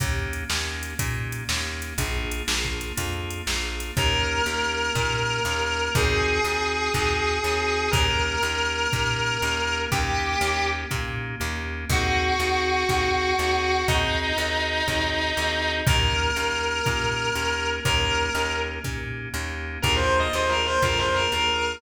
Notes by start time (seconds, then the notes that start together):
0.00 D#2 A#3 C#4 D#4 G4, kick, closed hi-hat
0.33 closed hi-hat
0.50 D#2 A#3 C#4 D#4 G4, snare
0.83 closed hi-hat
0.99 A#2 A#3 C#4 D#4 G4, kick, closed hi-hat
1.32 closed hi-hat
1.49 D#2 A#3 C#4 D#4 G4, snare
1.82 closed hi-hat
1.98 A#1 A#3 D4 F4 G#4, kick, closed hi-hat
2.32 closed hi-hat
2.48 A#1 A#3 D4 F4 G#4, snare
2.64 kick
2.81 closed hi-hat
2.97 F2 A#3 D4 F4 G#4, kick, closed hi-hat
3.30 closed hi-hat
3.47 A#1 A#3 D4 F4 G#4, snare
3.80 closed hi-hat
3.97 D#2 A#3 C#4 D#4 G4 A#4, kick
4.46 D#2 A#3 C#4 D#4 G4
4.95 A#2 A#3 C#4 D#4 G4, kick
5.45 D#2 A#3 C#4 D#4 G4
5.95 D#2 C4 D#4 F#4 G#4, kick
6.45 D#2 C4 D#4 F#4 G#4
6.94 D#2 C4 D#4 F#4 G#4, kick
7.44 D#2 C4 D#4 F#4 G#4
7.91 D#2 A#3 C#4 D#4 G4 A#4, kick
8.43 D#2 A#3 C#4 D#4 G4
8.93 A#2 A#3 C#4 D#4 G4, kick
9.42 D#2 A#3 C#4 D#4 G4
9.92 D#2 A#3 C#4 D#4 G4, kick
10.41 D#2 A#3 C#4 D#4 G4
10.91 A#2 A#3 C#4 D#4 G4, kick
11.40 D#2 A#3 C#4 D#4 G4
11.89 D#2 C4 D#4 F#4 G#4, kick
12.39 D#2 C4 D#4 F#4 G#4
12.89 D#2 C4 D#4 F#4 G#4, kick
13.38 D#2 C4 D#4 F#4 G#4
13.88 D#2 C4 D#4 F#4 G#4, kick
14.38 D#2 C4 D#4 F#4 G#4
14.88 D#2 C4 D#4 F#4 G#4, kick
15.37 D#2 C4 D#4 F#4 G#4
15.86 D#2 A#3 C#4 D#4 G4 A#4, kick
16.36 D#2 A#3 C#4 D#4 G4
16.86 A#2 A#3 C#4 D#4 G4, kick
17.35 D#2 A#3 C#4 D#4 G4
17.85 D#2 A#3 C#4 D#4 G4 A#4, kick
18.35 D#2 A#3 C#4 D#4 G4
18.84 A#2 A#3 C#4 D#4 G4, kick
19.34 D#2 A#3 C#4 D#4 G4
19.82 D#2 A#3 D4 F4 G#4 A#4, kick
19.96 C5
20.19 D#5
20.33 D#2 A#3 D4 F4 G#4 C5
20.49 A#4
20.66 C5
20.82 F2 A#3 D4 F4 G#4 A#4, kick
20.99 C5
21.14 A#4
21.32 D#2 A#3 D4 F4 G#4 A#4